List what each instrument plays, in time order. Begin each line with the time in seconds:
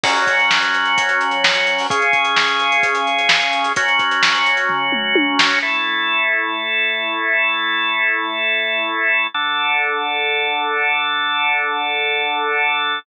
0.03 drawbar organ F#3 C#4 F#4, kick, crash
0.16 closed hi-hat
0.27 kick, closed hi-hat
0.39 closed hi-hat
0.51 snare
0.62 closed hi-hat
0.74 closed hi-hat
0.85 closed hi-hat
0.98 kick, closed hi-hat
1.09 closed hi-hat
1.21 closed hi-hat
1.31 closed hi-hat
1.44 snare
1.55 closed hi-hat
1.67 closed hi-hat
1.78 open hi-hat
1.90 drawbar organ C#3 C#4 G#4, kick, closed hi-hat
2.02 closed hi-hat
2.13 kick, closed hi-hat
2.25 closed hi-hat
2.37 snare
2.48 closed hi-hat
2.59 closed hi-hat
2.72 closed hi-hat
2.83 kick, closed hi-hat
2.95 closed hi-hat
3.07 closed hi-hat
3.19 closed hi-hat
3.29 snare
3.42 closed hi-hat
3.53 closed hi-hat
3.64 closed hi-hat
3.76 drawbar organ F#3 C#4 F#4, kick, closed hi-hat
3.88 closed hi-hat
3.99 kick, closed hi-hat
4.11 closed hi-hat
4.23 snare
4.35 closed hi-hat
4.46 closed hi-hat
4.57 closed hi-hat
4.69 kick, floor tom
4.92 mid tom
5.15 high tom
5.39 snare
5.62 drawbar organ A3 E4 A4
9.34 drawbar organ D3 D4 A4